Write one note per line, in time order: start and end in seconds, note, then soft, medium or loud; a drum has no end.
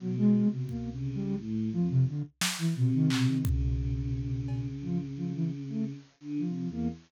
0.00 0.42 B2 loud
0.00 0.15 F#3 medium
0.17 0.48 G#3 loud
0.47 0.88 B2 medium
0.51 0.67 C3 medium
0.69 0.90 A#3 medium
0.69 kick medium
0.92 1.13 C3 medium
0.92 1.33 C#3 medium
1.15 1.36 G3 loud
1.38 1.69 A2 loud
1.72 2.04 F2 medium
1.72 1.88 F3 medium
1.90 2.05 C3 loud
2.07 2.23 D3 medium
2.41 snare loud
2.59 2.74 E3 medium
2.76 2.91 B2 medium
2.76 3.38 C3 loud
2.94 3.09 D#3 loud
3.10 3.26 B2 medium
3.10 clap loud
3.28 3.43 D#3 medium
3.45 4.69 B2 medium
3.45 5.93 C#3 medium
3.45 kick loud
4.48 cowbell soft
4.83 4.98 F3 medium
4.83 floor tom soft
5.17 5.32 F3 medium
5.35 5.50 E3 medium
5.69 5.84 A3 medium
6.20 6.41 D3 loud
6.38 6.69 F3 soft
6.44 6.64 C3 medium
6.67 6.87 E2 medium
6.72 6.88 A#3 medium